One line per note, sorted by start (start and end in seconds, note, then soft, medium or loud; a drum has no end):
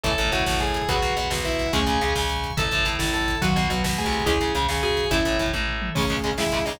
0.03 0.16 A1 medium
0.03 0.10 E3 medium
0.03 0.10 A3 loud
0.03 0.88 E4 medium
0.03 0.30 A4 medium
0.03 0.88 A4 medium
0.03 0.66 C#5 medium
0.03 0.66 E5 loud
0.03 0.30 A5 medium
0.03 kick loud
0.03 closed hi-hat medium
0.11 kick medium
0.18 0.30 A1 medium
0.18 0.31 A2 medium
0.18 kick medium
0.18 closed hi-hat medium
0.25 kick medium
0.32 0.44 A1 medium
0.32 0.44 A2 medium
0.32 0.58 F#4 medium
0.32 0.58 F#5 medium
0.32 kick medium
0.32 closed hi-hat medium
0.39 kick medium
0.46 0.83 A1 medium
0.46 0.82 A2 medium
0.46 kick medium
0.46 snare medium
0.54 kick medium
0.60 0.87 G#4 medium
0.60 0.87 G#5 medium
0.60 kick medium
0.60 closed hi-hat medium
0.67 kick medium
0.74 kick medium
0.74 closed hi-hat medium
0.82 kick medium
0.88 1.01 B1 medium
0.88 0.94 F#3 medium
0.88 0.94 B3 medium
0.88 1.12 F#4 medium
0.88 1.40 G#4 medium
0.88 1.40 B4 loud
0.88 1.72 F#5 medium
0.88 1.12 F#5 medium
0.88 1.72 B5 medium
0.88 kick loud
0.88 closed hi-hat medium
0.95 kick medium
1.02 1.14 B1 medium
1.02 1.14 B2 medium
1.02 kick medium
1.02 closed hi-hat medium
1.10 kick medium
1.16 1.29 B1 medium
1.16 1.29 B2 medium
1.16 kick medium
1.16 closed hi-hat medium
1.24 kick medium
1.30 1.67 B1 medium
1.30 1.66 B2 medium
1.30 kick medium
1.30 snare loud
1.38 kick medium
1.44 1.72 E4 medium
1.44 1.71 B4 loud
1.44 1.72 E5 medium
1.44 kick medium
1.44 closed hi-hat medium
1.52 kick medium
1.59 kick medium
1.59 closed hi-hat medium
1.66 kick medium
1.73 1.85 C#2 medium
1.73 1.79 G#3 medium
1.73 2.00 A3 loud
1.73 2.00 C#4 loud
1.73 1.79 C#4 medium
1.73 2.11 G#4 medium
1.73 2.56 G#5 medium
1.73 2.11 G#5 medium
1.73 2.56 C#6 medium
1.73 kick medium
1.73 closed hi-hat medium
1.80 kick medium
1.86 1.98 C#2 medium
1.86 1.99 C#3 medium
1.86 kick medium
1.86 closed hi-hat medium
1.94 kick medium
2.01 2.14 C#2 medium
2.01 2.14 C#3 medium
2.01 kick medium
2.01 closed hi-hat medium
2.08 kick medium
2.15 2.51 C#2 medium
2.15 2.51 C#3 medium
2.15 kick medium
2.15 snare medium
2.22 kick medium
2.29 kick medium
2.29 closed hi-hat medium
2.36 kick medium
2.43 kick medium
2.43 closed hi-hat medium
2.50 kick medium
2.57 2.69 A1 medium
2.57 3.19 C#3 medium
2.57 3.19 E3 loud
2.57 3.41 E4 medium
2.57 2.63 A4 medium
2.57 3.41 A4 medium
2.57 2.86 A4 medium
2.57 2.63 E5 medium
2.57 2.86 A5 medium
2.57 kick loud
2.57 closed hi-hat medium
2.65 kick medium
2.71 2.84 A1 medium
2.71 2.84 A2 medium
2.71 kick medium
2.71 closed hi-hat medium
2.78 kick medium
2.85 2.97 A1 medium
2.85 2.98 A2 medium
2.85 kick medium
2.85 closed hi-hat medium
2.93 kick medium
2.99 3.35 A1 medium
2.99 3.35 A2 medium
2.99 kick medium
2.99 snare loud
3.07 kick medium
3.14 3.37 A4 medium
3.14 3.37 A5 medium
3.14 kick medium
3.14 closed hi-hat medium
3.21 kick medium
3.28 kick medium
3.28 closed hi-hat medium
3.35 kick medium
3.41 3.54 B1 medium
3.41 3.65 D#3 loud
3.41 3.65 F#3 loud
3.41 3.47 F#4 medium
3.41 3.66 F#4 medium
3.41 4.26 F#4 medium
3.41 3.47 B4 medium
3.41 4.26 B4 medium
3.41 3.66 F#5 medium
3.41 kick medium
3.41 closed hi-hat medium
3.49 kick medium
3.56 3.68 B1 medium
3.56 3.68 B2 medium
3.56 kick medium
3.56 closed hi-hat medium
3.63 kick medium
3.70 3.82 B1 medium
3.70 3.82 B2 medium
3.70 3.96 F#3 medium
3.70 kick medium
3.70 closed hi-hat medium
3.77 kick medium
3.84 4.03 B1 medium
3.84 4.03 B2 medium
3.84 kick medium
3.84 snare loud
3.91 kick medium
3.98 4.23 A3 loud
3.98 4.22 G#4 medium
3.98 4.22 G#5 medium
3.98 kick medium
3.98 closed hi-hat medium
4.06 4.25 C2 medium
4.06 4.25 C3 medium
4.06 kick medium
4.12 kick medium
4.12 closed hi-hat medium
4.20 kick medium
4.26 4.38 C#2 medium
4.26 4.32 G#3 medium
4.26 4.32 C#4 medium
4.26 4.53 E4 loud
4.26 4.49 G#4 medium
4.26 4.53 G#4 loud
4.26 5.11 G#4 medium
4.26 5.11 C#5 medium
4.26 4.49 G#5 loud
4.26 kick loud
4.26 closed hi-hat medium
4.34 kick medium
4.40 4.52 C#2 medium
4.40 4.53 C#3 medium
4.40 kick medium
4.40 closed hi-hat medium
4.48 kick medium
4.55 4.67 C#2 medium
4.55 4.67 C#3 medium
4.55 kick medium
4.55 closed hi-hat medium
4.62 kick medium
4.68 5.05 C#2 medium
4.68 5.05 C#3 medium
4.68 kick medium
4.68 snare medium
4.76 kick medium
4.83 5.10 F#4 loud
4.83 5.07 G#4 medium
4.83 5.07 G#5 medium
4.83 kick medium
4.83 closed hi-hat medium
4.90 kick medium
4.97 kick medium
4.97 closed hi-hat medium
5.04 kick medium
5.11 5.23 A1 medium
5.11 5.17 A3 medium
5.11 5.36 C#4 medium
5.11 5.35 E4 medium
5.11 5.36 E4 loud
5.11 5.17 E4 medium
5.11 5.95 A4 medium
5.11 5.35 E5 medium
5.11 5.95 E5 medium
5.11 kick loud
5.11 closed hi-hat medium
5.18 kick medium
5.25 5.37 A1 medium
5.25 5.38 A2 medium
5.25 kick medium
5.25 closed hi-hat medium
5.32 kick medium
5.39 5.51 A1 medium
5.39 5.52 A2 medium
5.39 5.53 E3 medium
5.39 kick medium
5.39 closed hi-hat medium
5.46 kick medium
5.53 5.89 A1 medium
5.53 5.90 A2 medium
5.53 kick medium
5.53 high tom medium
5.68 floor tom medium
5.82 mid tom loud
5.95 6.02 C#2 medium
5.95 6.37 C#3 medium
5.95 6.02 C#3 medium
5.95 6.02 G#3 medium
5.95 6.31 A3 loud
5.95 6.08 C#4 medium
5.95 6.31 C#4 loud
5.95 6.37 C#4 medium
5.95 6.37 G#4 loud
5.95 6.08 C#5 loud
5.95 kick loud
5.95 crash loud
6.03 kick medium
6.10 6.15 C#2 medium
6.10 6.15 C#3 medium
6.10 6.15 G#3 medium
6.10 kick medium
6.10 closed hi-hat medium
6.17 kick medium
6.24 6.30 C#2 medium
6.24 6.30 C#3 medium
6.24 6.30 G#3 medium
6.24 kick medium
6.24 closed hi-hat medium
6.31 kick medium
6.38 6.43 C#2 medium
6.38 6.43 C#3 medium
6.38 6.79 C#3 medium
6.38 6.43 G#3 medium
6.38 6.79 G#3 loud
6.38 6.78 G#3 medium
6.38 6.62 E4 medium
6.38 6.79 G#4 loud
6.38 6.62 E5 medium
6.38 kick medium
6.38 snare loud
6.45 kick medium
6.52 6.58 C#2 medium
6.52 6.58 C#3 medium
6.52 6.58 G#3 medium
6.52 kick medium
6.52 closed hi-hat medium
6.59 kick medium
6.65 6.72 C#2 medium
6.65 6.72 C#3 medium
6.65 6.72 G#3 medium
6.65 6.78 D#4 medium
6.65 6.78 D#5 medium
6.65 kick medium
6.65 open hi-hat medium
6.73 kick medium